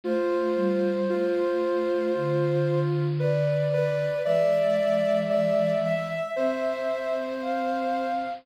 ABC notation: X:1
M:4/4
L:1/8
Q:1/4=57
K:C
V:1 name="Ocarina"
c6 d2 | e6 f2 |]
V:2 name="Ocarina"
F2 F2 F2 B B | d2 d e c4 |]
V:3 name="Ocarina"
A, G, A,2 D,4 | [E,^G,]4 C4 |]